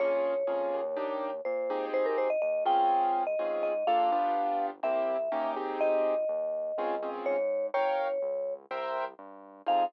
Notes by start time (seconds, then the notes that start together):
0.00 A#1 A#3 C#4 F4 G#4 C#5
0.47 F2 A#3 C#4 F4 G#4
0.73 D#2
0.96 A#3 D4 D#4 G4
1.45 A#2 C5
1.70 C4 D#4 G4 G#4
1.93 G#1 C5
2.06 A#4
2.18 C5
2.30 D#5
2.42 D#2 D#5
2.65 C#2 C4 C#4 F4 G#4 G5
3.27 D#5
3.39 G#2 C4 C#4 F4 G#4
3.63 D#5
3.86 A#1 A#3 D4 F4 A4 F5
4.12 G1 B3 D4 F4 G4
4.83 C2 A#3 C4 E4 G4 E5
5.32 D#2 A#3 C#4 D#4 G4
5.56 C4 D#4 G4 G#4
5.81 G#1 D#5
6.29 D#2
6.78 C#2 C4 C#4 F4 G#4
7.03 C4 C#4 F4 G#4
7.26 G#2 C#5
7.74 G1 A#4 C#5 F5 G5
8.22 C#2
8.71 C2 A#4 C5 E5 G5
9.18 G2
9.66 F2 C4 D#4 F4 G#4 F5